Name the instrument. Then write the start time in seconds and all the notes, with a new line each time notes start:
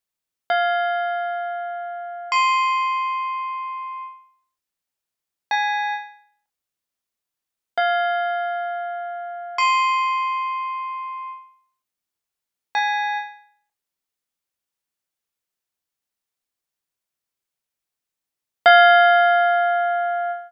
tubular bells
0.50 F5
2.32 C6
5.51 G#5
7.78 F5
9.58 C6
12.75 G#5
18.66 F5